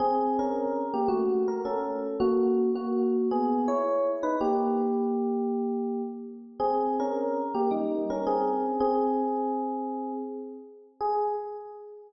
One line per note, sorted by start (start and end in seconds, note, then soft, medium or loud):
0.00 0.37 C4 loud
0.00 0.37 G#4 loud
0.39 0.84 C#4 medium
0.39 0.84 A#4 medium
0.94 1.09 A#3 medium
0.94 1.09 G4 medium
1.08 1.45 A3 medium
1.08 1.45 F#4 loud
1.48 1.61 A#4 medium
1.65 2.16 C#4 medium
1.65 2.16 A4 medium
2.20 2.69 A#3 loud
2.20 2.69 F#4 loud
2.75 3.28 A#3 medium
2.75 3.28 F#4 loud
3.31 3.65 B3 medium
3.31 3.65 G#4 loud
3.68 4.08 E4 medium
3.68 4.08 C#5 medium
4.23 4.37 D#4 medium
4.23 4.37 B4 loud
4.41 6.02 A#3 medium
4.41 6.02 G4 loud
6.60 6.95 C4 medium
6.60 6.95 G#4 loud
7.00 7.40 C#4 medium
7.00 7.40 A#4 medium
7.54 7.70 A#3 medium
7.54 7.70 G4 medium
7.71 8.03 G3 medium
7.71 8.03 D#4 medium
8.10 8.25 C#4 medium
8.10 8.25 A#4 medium
8.27 8.78 C4 medium
8.27 8.78 G#4 loud
8.80 10.12 C4 loud
8.80 10.12 G#4 loud
11.01 11.28 G#4 loud